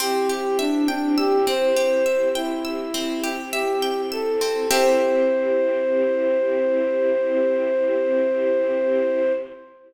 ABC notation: X:1
M:4/4
L:1/16
Q:1/4=51
K:Clyd
V:1 name="Flute"
G G D D G c3 E4 G2 A2 | c16 |]
V:2 name="Pizzicato Strings"
C G e g e' C G e g e' C G e g e' C | [CGe]16 |]
V:3 name="String Ensemble 1"
[CEG]16 | [CEG]16 |]